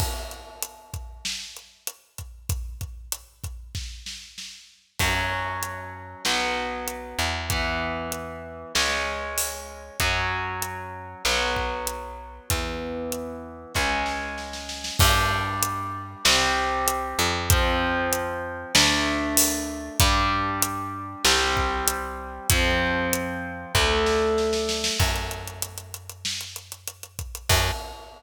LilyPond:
<<
  \new Staff \with { instrumentName = "Overdriven Guitar" } { \time 4/4 \key fis \minor \tempo 4 = 96 r1 | r1 | <fis cis'>2 <fis b>2 | <e b>2 <gis cis'>2 |
<fis cis'>2 <fis b>2 | <e b>2 <gis cis'>2 | \key g \minor <g d'>2 <g c'>2 | <f c'>2 <a d'>2 |
<g d'>2 <g c'>2 | <f c'>2 <a d'>2 | \key fis \minor r1 | r1 | }
  \new Staff \with { instrumentName = "Electric Bass (finger)" } { \clef bass \time 4/4 \key fis \minor r1 | r1 | fis,2 b,,4. e,8~ | e,2 cis,2 |
fis,2 b,,2 | e,2 cis,2 | \key g \minor g,2 c,4. f,8~ | f,2 d,2 |
g,2 c,2 | f,2 d,2 | \key fis \minor fis,1 | fis,4 r2. | }
  \new DrumStaff \with { instrumentName = "Drums" } \drummode { \time 4/4 <cymc bd>8 hh8 hh8 <hh bd>8 sn8 hh8 hh8 <hh bd>8 | <hh bd>8 <hh bd>8 hh8 <hh bd>8 <bd sn>8 sn8 sn4 | <cymc bd>4 hh4 sn4 hh4 | <hh bd>4 hh4 sn4 hho4 |
<hh bd>4 hh4 sn8 bd8 hh4 | <hh bd>4 hh4 <bd sn>8 sn8 sn16 sn16 sn16 sn16 | <cymc bd>4 hh4 sn4 hh4 | <hh bd>4 hh4 sn4 hho4 |
<hh bd>4 hh4 sn8 bd8 hh4 | <hh bd>4 hh4 <bd sn>8 sn8 sn16 sn16 sn16 sn16 | <cymc bd>16 hh16 hh16 hh16 hh16 hh16 hh16 hh16 sn16 hh16 hh16 hh16 hh16 hh16 <hh bd>16 hh16 | <cymc bd>4 r4 r4 r4 | }
>>